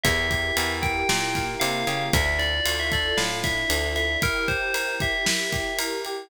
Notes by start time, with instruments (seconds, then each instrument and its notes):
0.03 electric bass (finger) E2, string ensemble 1 E4 G4 A#4, electric piano 1 E4, tubular bells E5, kick, ride
0.31 electric piano 1 G4, kick, ride
0.57 electric bass (finger) E2, electric piano 1 A#4, ride
0.82 electric piano 1 E4, tubular bells G5, kick, ride
1.09 electric bass (finger) A#2, string ensemble 1 A#3 E4 A#4, electric piano 1 G4, snare
1.35 electric piano 1 A#4, kick, snare, ride
1.60 electric bass (finger) C3, electric piano 1 E4, tubular bells F5, ride
1.87 electric bass (finger) C#3, electric piano 1 G4, ride
2.12 electric bass (finger) D2, string ensemble 1 D4 E4 F4 A4, electric piano 1 D4, tubular bells E5, kick, ride
2.26 tubular bells E5
2.39 electric piano 1 E4, tubular bells D5, ride
2.66 electric bass (finger) D2, electric piano 1 F4, ride
2.80 tubular bells E5
2.92 electric piano 1 A4, tubular bells D5, kick, ride
3.17 electric bass (finger) A2, electric piano 1 F4, tubular bells F5, snare
3.44 electric piano 1 E4, tubular bells E5, kick, snare, ride
3.69 electric bass (finger) D2, electric piano 1 D4, ride
3.96 electric piano 1 E4, tubular bells E5, ride
4.21 string ensemble 1 E4 G4 A#4, electric piano 1 E4, tubular bells A#4, kick, ride
4.48 electric piano 1 G4, tubular bells C5, kick, ride
4.74 electric piano 1 A#4, ride
5.00 electric piano 1 G4, tubular bells E5, kick, ride
5.25 electric piano 1 E4, snare
5.52 electric piano 1 G4, kick, snare, ride
5.79 electric piano 1 A#4, ride
6.05 electric piano 1 G4, ride